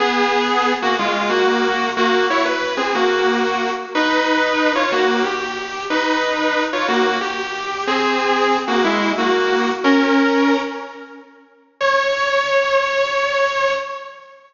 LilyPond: \new Staff { \time 12/8 \key des \major \tempo 4. = 122 <ces' aes'>2~ <ces' aes'>8 <bes ges'>8 <aes f'>4 <bes ges'>2 | <bes ges'>4 <fes' des''>8 b'4 <c' aes'>8 <bes ges'>2~ <bes ges'>8 r8 | <ees' ces''>2~ <ees' ces''>8 <f' des''>8 <bes ges'>4 g'2 | <ees' ces''>2~ <ees' ces''>8 <f' des''>8 <bes ges'>4 g'2 |
<c' aes'>2~ <c' aes'>8 <bes ges'>8 <aes fes'>4 <bes ges'>2 | <des' bes'>2~ <des' bes'>8 r2. r8 | des''1. | }